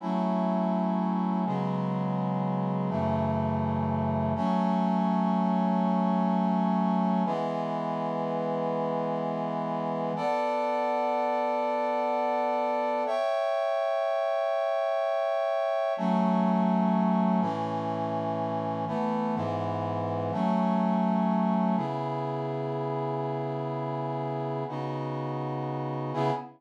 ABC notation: X:1
M:3/4
L:1/8
Q:1/4=124
K:F#m
V:1 name="Brass Section"
[F,A,CE]6 | [C,F,G,B,]6 | [F,,C,E,A,]6 | [F,A,C]6- |
[F,A,C]6 | [E,G,B,]6- | [E,G,B,]6 | [K:Bm] [B,Adf]6- |
[B,Adf]6 | [ceg]6- | [ceg]6 | [K:F#m] [F,A,C]6 |
[A,,E,C]6 | [E,A,B,]2 [G,,E,B,]4 | [F,A,C]6 | [K:C#m] [C,B,EG]6- |
[C,B,EG]6 | [C,B,DF]6 | [C,B,EG]2 z4 |]